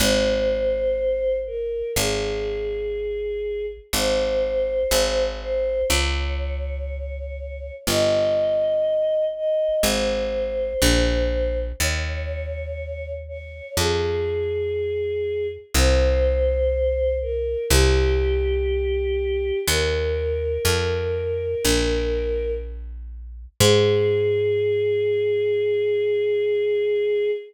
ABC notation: X:1
M:4/4
L:1/8
Q:1/4=61
K:Ab
V:1 name="Choir Aahs"
c3 B A4 | c3 c d4 | e3 e c4 | d3 d A4 |
c3 B G4 | B6 z2 | A8 |]
V:2 name="Electric Bass (finger)" clef=bass
A,,,4 A,,,4 | A,,,2 A,,,2 D,,4 | G,,,4 A,,,2 B,,,2 | E,,4 F,,4 |
C,,4 C,,4 | E,,2 F,,2 B,,,4 | A,,8 |]